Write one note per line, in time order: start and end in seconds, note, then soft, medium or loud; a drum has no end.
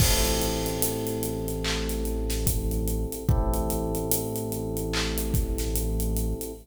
0.00 3.06 A1 medium
0.00 3.24 C4 medium
0.00 3.24 E4 medium
0.00 3.24 G4 medium
0.00 3.24 A4 medium
0.00 kick loud
0.00 crash loud
0.25 closed hi-hat medium
0.42 closed hi-hat medium
0.66 closed hi-hat medium
0.82 closed hi-hat loud
1.07 closed hi-hat medium
1.23 closed hi-hat medium
1.48 closed hi-hat medium
1.64 clap loud
1.89 snare soft
1.89 closed hi-hat medium
2.05 closed hi-hat medium
2.30 snare medium
2.30 closed hi-hat medium
2.47 kick medium
2.47 closed hi-hat loud
2.71 closed hi-hat medium
2.88 closed hi-hat medium
3.12 closed hi-hat medium
3.29 6.34 A1 medium
3.29 6.52 C4 medium
3.29 6.52 E4 medium
3.29 6.52 G4 medium
3.29 6.52 A4 medium
3.29 kick loud
3.54 closed hi-hat medium
3.70 closed hi-hat medium
3.95 closed hi-hat medium
4.11 closed hi-hat loud
4.36 closed hi-hat medium
4.52 closed hi-hat medium
4.77 closed hi-hat medium
4.93 clap loud
5.18 closed hi-hat medium
5.34 kick loud
5.34 closed hi-hat medium
5.58 snare medium
5.58 closed hi-hat medium
5.76 closed hi-hat loud
6.00 closed hi-hat medium
6.17 closed hi-hat medium
6.41 closed hi-hat medium